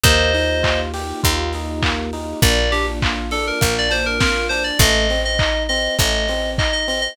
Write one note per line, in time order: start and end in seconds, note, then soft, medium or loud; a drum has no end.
0.03 1.13 D#2 medium
0.03 2.40 A#3 medium
0.03 0.32 A#3 medium
0.03 2.40 D#4 medium
0.03 2.40 F4 medium
0.03 2.40 G4 medium
0.03 0.80 C5 loud
0.03 0.80 D#5 loud
0.03 kick loud
0.03 closed hi-hat loud
0.34 0.61 D#4 medium
0.34 open hi-hat medium
0.63 0.90 F4 medium
0.63 kick medium
0.63 clap loud
0.94 1.21 G4 medium
0.94 open hi-hat loud
1.23 2.34 D#2 medium
1.23 1.50 F4 medium
1.23 kick loud
1.23 closed hi-hat loud
1.53 1.81 D#4 medium
1.53 open hi-hat medium
1.82 2.09 A#3 medium
1.82 kick loud
1.82 clap loud
2.13 2.40 D#4 medium
2.13 open hi-hat medium
2.42 3.52 A#1 medium
2.42 2.69 A#3 loud
2.42 4.78 A#3 medium
2.42 4.78 D4 medium
2.42 4.78 F4 medium
2.42 2.71 D5 loud
2.42 kick loud
2.42 closed hi-hat loud
2.72 2.99 D4 medium
2.72 2.86 G4 loud
2.72 open hi-hat loud
3.02 3.29 F4 medium
3.02 kick loud
3.02 clap loud
3.31 3.59 D4 medium
3.31 3.45 A4 medium
3.31 open hi-hat loud
3.47 3.75 A#4 medium
3.61 4.71 A#1 medium
3.61 3.88 A#3 medium
3.61 kick loud
3.61 closed hi-hat loud
3.78 3.93 D5 loud
3.90 4.16 D4 medium
3.90 4.05 C5 loud
3.90 open hi-hat loud
4.06 4.20 A#4 medium
4.20 4.48 F4 medium
4.20 4.47 A#4 medium
4.20 kick loud
4.20 snare loud
4.49 4.77 D4 medium
4.49 4.63 C5 loud
4.49 open hi-hat loud
4.64 4.78 D5 medium
4.79 5.88 A1 medium
4.79 5.07 A3 loud
4.79 5.21 D#5 loud
4.79 kick loud
4.79 closed hi-hat loud
5.10 5.37 C4 medium
5.10 open hi-hat medium
5.25 5.63 D#5 loud
5.39 5.67 D#4 medium
5.39 kick loud
5.39 clap loud
5.69 5.96 C4 medium
5.69 5.95 D#5 loud
5.69 open hi-hat loud
5.99 7.08 A1 medium
5.99 6.26 A3 medium
5.99 6.50 D#5 loud
5.99 kick loud
5.99 closed hi-hat loud
6.28 6.56 C4 medium
6.28 open hi-hat loud
6.58 6.86 D#4 medium
6.58 6.72 D#5 medium
6.58 kick loud
6.58 clap loud
6.73 6.87 D#5 loud
6.88 7.15 C4 medium
6.88 7.01 D#5 medium
6.88 open hi-hat loud
7.01 7.16 D#5 loud